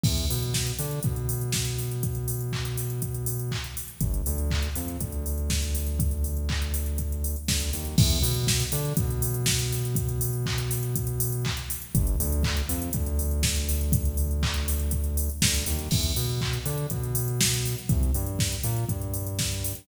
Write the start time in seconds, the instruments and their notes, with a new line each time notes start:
0.04 synth bass 1 E2, kick, crash
0.18 closed hi-hat
0.30 synth bass 1 B2, open hi-hat
0.43 closed hi-hat
0.54 kick, snare
0.67 closed hi-hat
0.79 synth bass 1 D3, open hi-hat
0.91 closed hi-hat
1.03 synth bass 1 B2, kick, closed hi-hat
1.16 closed hi-hat
1.29 open hi-hat
1.41 closed hi-hat
1.52 kick, snare
1.65 closed hi-hat
1.79 open hi-hat
1.91 closed hi-hat
2.03 kick, closed hi-hat
2.15 closed hi-hat
2.28 open hi-hat
2.41 closed hi-hat
2.53 kick, clap
2.65 closed hi-hat
2.78 open hi-hat
2.90 closed hi-hat
3.02 kick, closed hi-hat
3.14 closed hi-hat
3.26 open hi-hat
3.39 closed hi-hat
3.51 kick, clap
3.64 closed hi-hat
3.77 open hi-hat
3.88 closed hi-hat
4.01 synth bass 1 G1, kick, closed hi-hat
4.14 closed hi-hat
4.26 synth bass 1 D2, open hi-hat
4.38 closed hi-hat
4.51 kick, clap
4.63 closed hi-hat
4.76 synth bass 1 F2, open hi-hat
4.88 closed hi-hat
5.01 synth bass 1 D2, kick, closed hi-hat
5.12 closed hi-hat
5.26 open hi-hat
5.38 closed hi-hat
5.50 kick, snare
5.62 closed hi-hat
5.75 open hi-hat
5.87 closed hi-hat
5.99 kick, closed hi-hat
6.11 closed hi-hat
6.24 open hi-hat
6.37 closed hi-hat
6.49 kick, clap
6.62 closed hi-hat
6.74 open hi-hat
6.86 closed hi-hat
6.98 kick, closed hi-hat
7.12 closed hi-hat
7.24 open hi-hat
7.36 closed hi-hat
7.48 synth bass 1 D2, kick, snare
7.60 closed hi-hat
7.73 synth bass 1 D#2, open hi-hat
7.85 closed hi-hat
7.98 synth bass 1 E2, kick, crash
8.10 closed hi-hat
8.22 synth bass 1 B2, open hi-hat
8.34 closed hi-hat
8.47 kick, snare
8.60 closed hi-hat
8.72 synth bass 1 D3, open hi-hat
8.85 closed hi-hat
8.97 synth bass 1 B2, kick, closed hi-hat
9.11 closed hi-hat
9.22 open hi-hat
9.34 closed hi-hat
9.46 kick, snare
9.59 closed hi-hat
9.73 open hi-hat
9.85 closed hi-hat
9.95 kick, closed hi-hat
10.09 closed hi-hat
10.21 open hi-hat
10.33 closed hi-hat
10.46 kick, clap
10.58 closed hi-hat
10.71 open hi-hat
10.83 closed hi-hat
10.96 kick, closed hi-hat
11.07 closed hi-hat
11.20 open hi-hat
11.32 closed hi-hat
11.45 kick, clap
11.57 closed hi-hat
11.70 open hi-hat
11.82 closed hi-hat
11.95 synth bass 1 G1, kick, closed hi-hat
12.07 closed hi-hat
12.20 synth bass 1 D2, open hi-hat
12.32 closed hi-hat
12.43 kick, clap
12.57 closed hi-hat
12.69 synth bass 1 F2, open hi-hat
12.82 closed hi-hat
12.93 synth bass 1 D2, kick, closed hi-hat
13.06 closed hi-hat
13.19 open hi-hat
13.31 closed hi-hat
13.43 kick, snare
13.56 closed hi-hat
13.69 open hi-hat
13.81 closed hi-hat
13.92 kick, closed hi-hat
14.05 closed hi-hat
14.17 open hi-hat
14.31 closed hi-hat
14.43 kick, clap
14.54 closed hi-hat
14.68 open hi-hat
14.80 closed hi-hat
14.91 kick, closed hi-hat
15.04 closed hi-hat
15.17 open hi-hat
15.30 closed hi-hat
15.42 synth bass 1 D2, kick, snare
15.54 closed hi-hat
15.66 synth bass 1 D#2, open hi-hat
15.79 closed hi-hat
15.91 synth bass 1 E2, kick, crash
16.03 closed hi-hat
16.16 synth bass 1 B2, open hi-hat
16.29 closed hi-hat
16.41 kick, clap
16.53 closed hi-hat
16.66 synth bass 1 D3, open hi-hat
16.78 closed hi-hat
16.90 synth bass 1 B2, kick, closed hi-hat
17.04 closed hi-hat
17.15 open hi-hat
17.28 closed hi-hat
17.41 kick, snare
17.54 closed hi-hat
17.65 open hi-hat
17.79 closed hi-hat
17.89 synth bass 1 C2, kick, closed hi-hat
18.03 closed hi-hat
18.14 synth bass 1 G2, open hi-hat
18.27 closed hi-hat
18.39 kick, snare
18.52 closed hi-hat
18.64 synth bass 1 A#2, open hi-hat
18.77 closed hi-hat
18.89 synth bass 1 G2, kick, closed hi-hat
19.02 closed hi-hat
19.14 open hi-hat
19.27 closed hi-hat
19.39 kick, snare
19.52 closed hi-hat
19.64 open hi-hat
19.75 closed hi-hat